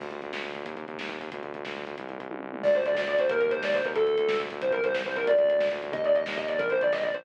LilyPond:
<<
  \new Staff \with { instrumentName = "Distortion Guitar" } { \time 6/8 \key d \phrygian \tempo 4. = 182 r2. | r2. | r2. | r2. |
d''8 c''8 d''8 d''8 d''8 c''8 | bes'8 bes'8 c''8 d''8 c''8 bes'8 | a'2 r4 | c''8 bes'8 c''8 c''8 c''8 bes'8 |
d''4. r4. | ees''8 d''8 ees''8 ees''8 ees''8 d''8 | bes'8 c''8 d''8 ees''8 d''8 c''8 | }
  \new Staff \with { instrumentName = "Synth Bass 1" } { \clef bass \time 6/8 \key d \phrygian d,8 d,8 d,8 d,8 d,8 d,8 | ees,8 ees,8 ees,8 ees,8 ees,8 ees,8 | d,8 d,8 d,8 d,8 d,8 d,8 | c,8 c,8 c,8 c,8 c,8 c,8 |
d,8 d,8 d,8 d,8 d,8 d,8 | ees,8 ees,8 ees,8 ees,8 ees,8 ees,8 | d,8 d,8 d,8 d,8 d,8 d,8 | c,8 c,8 c,8 c,8 c,8 c,8 |
d,8 d,8 d,8 d,8 d,8 d,8 | ees,8 ees,8 ees,8 ees,8 ees,8 ees,8 | bes,,8 bes,,8 bes,,8 bes,,8 bes,,8 bes,,8 | }
  \new DrumStaff \with { instrumentName = "Drums" } \drummode { \time 6/8 <cymc bd>16 bd16 <hh bd>16 bd16 <hh bd>16 bd16 <bd sn>16 bd16 <hh bd>16 bd16 <hh bd>16 bd16 | <hh bd>16 bd16 <hh bd>16 bd16 <hh bd>16 bd16 <bd sn>16 bd16 <hh bd>16 bd16 <hh bd>16 bd16 | <hh bd>16 bd16 <hh bd>16 bd16 <hh bd>16 bd16 <bd sn>16 bd16 bd16 bd16 <hh bd>16 bd16 | <hh bd>16 bd16 <hh bd>16 bd16 <hh bd>16 bd16 <bd tommh>8 tomfh8 toml8 |
<cymc bd>16 bd16 <hh bd>16 bd16 <hh bd>16 bd16 <bd sn>16 bd16 <hh bd>16 bd16 <hh bd>16 bd16 | <hh bd>16 bd16 <hh bd>16 bd16 <hh bd>16 bd16 <bd sn>16 bd16 <hh bd>16 bd16 <hh bd>16 bd16 | <hh bd>16 bd16 <hh bd>16 bd16 <hh bd>8 <bd sn>16 bd16 <hh bd>16 bd16 <hh bd>16 bd16 | <hh bd>16 bd16 <hh bd>16 bd16 <hh bd>16 bd16 <bd sn>16 bd16 <hh bd>16 bd16 <hh bd>16 bd16 |
hh16 bd16 <hh bd>16 bd16 <hh bd>16 bd16 <bd sn>16 bd16 <hh bd>16 bd16 <hh bd>16 bd16 | <hh bd>16 bd16 <hh bd>16 bd16 <hh bd>16 bd16 <bd sn>16 bd16 <hh bd>16 bd16 <hh bd>16 bd16 | <hh bd>16 bd16 <hh bd>16 bd16 <hh bd>16 bd16 <bd sn>16 bd16 <hh bd>16 bd16 <hh bd>16 bd16 | }
>>